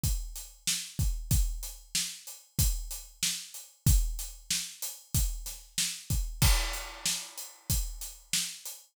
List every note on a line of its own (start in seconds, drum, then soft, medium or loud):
0.03 kick medium
0.03 closed hi-hat loud
0.36 closed hi-hat medium
0.67 snare loud
0.99 kick loud
0.99 closed hi-hat medium
1.31 kick loud
1.31 closed hi-hat loud
1.63 closed hi-hat medium
1.95 snare loud
2.27 closed hi-hat medium
2.59 kick loud
2.59 closed hi-hat loud
2.91 closed hi-hat medium
3.23 snare loud
3.54 closed hi-hat medium
3.86 kick loud
3.86 closed hi-hat loud
4.19 closed hi-hat medium
4.51 snare loud
4.82 closed hi-hat medium
5.14 kick loud
5.14 closed hi-hat loud
5.46 snare soft
5.46 closed hi-hat medium
5.78 snare loud
6.10 kick medium
6.10 closed hi-hat medium
6.42 kick loud
6.42 crash loud
6.73 closed hi-hat medium
7.05 snare loud
7.38 closed hi-hat medium
7.70 kick medium
7.70 closed hi-hat loud
8.01 closed hi-hat medium
8.33 snare loud
8.65 closed hi-hat medium